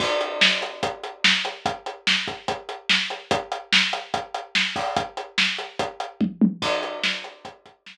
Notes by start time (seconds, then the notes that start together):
0.00 kick, crash
0.21 closed hi-hat
0.41 snare
0.62 closed hi-hat
0.83 kick, closed hi-hat
1.03 closed hi-hat
1.24 snare
1.45 closed hi-hat
1.66 kick, closed hi-hat
1.86 closed hi-hat
2.07 snare
2.28 kick, closed hi-hat
2.48 kick, closed hi-hat
2.69 closed hi-hat
2.89 snare
3.10 closed hi-hat
3.31 kick, closed hi-hat
3.52 closed hi-hat
3.72 snare
3.93 closed hi-hat
4.14 kick, closed hi-hat
4.34 closed hi-hat
4.55 snare
4.76 kick, open hi-hat
4.96 kick, closed hi-hat
5.17 closed hi-hat
5.38 snare
5.58 closed hi-hat
5.79 kick, closed hi-hat
6.00 closed hi-hat
6.21 kick, high tom
6.41 high tom
6.62 kick, crash
6.83 closed hi-hat
7.03 snare
7.24 closed hi-hat
7.45 kick, closed hi-hat
7.66 kick, closed hi-hat
7.86 snare